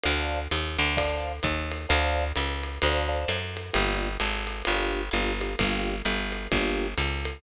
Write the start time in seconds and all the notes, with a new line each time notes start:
0.03 D2 C5 D5 F5 A5, ride
0.51 D#2, hi-hat pedal, ride
0.78 D2, ride
0.97 C5 D5 F5 A5, kick, ride
1.43 D#2, kick, hi-hat pedal, ride
1.72 ride
1.89 D2 C5 D5 F5 A5, ride
2.36 C#2, hi-hat pedal, ride
2.63 ride
2.82 D2 C5 D5 F5 A5, ride
3.08 C5 D5 F5 A5
3.28 F#2, hi-hat pedal, ride
3.57 ride
3.73 G1 A#3 D4 F4 G4, ride
4.20 G#1, hi-hat pedal, ride
4.47 ride
4.65 G1 A#3 D4 F4 G4, ride
5.11 G1 A#3 D4 F4 G4, hi-hat pedal, ride
5.40 A#3 D4 F4 G4, ride
5.59 G1 A#3 D4 F4 G4, kick, ride
6.05 G1, hi-hat pedal, ride
6.32 ride
6.52 G1 A#3 D4 F4 G4, kick, ride
6.98 C#2, hi-hat pedal, ride
7.25 ride